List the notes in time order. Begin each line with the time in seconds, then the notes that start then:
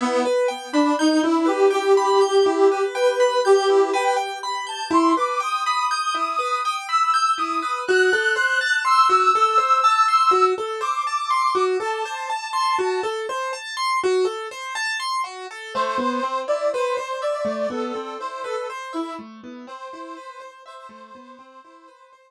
0.01 B3 E4
0.25 B4
0.48 G5
0.73 D4 B5
0.99 D#4 G6
1.23 E4
1.46 G4 B4
1.70 G4 G5
1.97 B5
2.21 G6
2.46 E4
2.72 B4
2.94 B4 G5
3.20 B5
3.45 G4 G6
3.70 E4
3.93 B4 G5
4.16 G5
4.43 B5
4.67 A5 G6
4.91 E4 C6
5.17 B4 D6
5.40 G5 D#6
5.65 B5 D#6
5.91 G6
6.15 E4
6.39 B4
6.65 G5
6.88 B5 E6
7.14 G6
7.37 E4 D#6
7.62 B4
7.87 F#4 F#6
8.13 A4
8.36 C5
8.61 A5
8.85 C6 E6
9.09 F#4
9.35 A4
9.58 C5
9.84 A5
10.08 C6
10.31 F#4
10.58 A4
10.81 C5 D6
11.07 A5
11.30 C6
11.55 F#4
11.80 A4 A5
12.05 C5
12.30 A5
12.53 C6
12.78 F#4
13.03 A4
13.29 C5
13.53 A5
13.77 C6
14.03 F#4
14.25 A4
14.51 C5
14.75 A5
15.00 C6
15.24 F#4
15.51 A4
15.74 A3 C5
15.98 B3
16.23 C4
16.48 E4 D5
16.72 B4 C5
16.97 C5
17.22 D5 E5
17.45 A3
17.70 B3 A4
17.95 C4
18.19 E4 C5
18.44 A4 B4
18.70 C5
18.93 E4 E5
19.19 A3
19.44 B3
19.67 C4 C5
19.93 E4
20.17 B4
20.40 C5
20.66 C5 E5
20.89 A3
21.15 B3
21.39 C4
21.65 E4
21.88 B4
22.13 C5